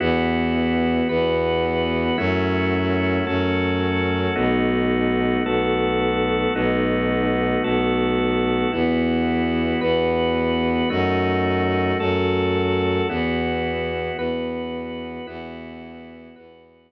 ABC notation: X:1
M:6/8
L:1/8
Q:3/8=55
K:E
V:1 name="Drawbar Organ"
[B,EF]3 [B,FB]3 | [A,CEF]3 [A,CFA]3 | [A,B,DF]3 [A,B,FA]3 | [A,B,DF]3 [A,B,FA]3 |
[B,EF]3 [B,FB]3 | [A,DF]3 [A,FA]3 | [B,EF]3 [B,FB]3 | [B,EF]3 [B,FB]3 |]
V:2 name="Violin" clef=bass
E,,3 E,,3 | F,,3 F,,3 | B,,,3 B,,,3 | B,,,3 B,,,3 |
E,,3 E,,3 | F,,3 F,,3 | E,,3 E,,3 | E,,3 E,,3 |]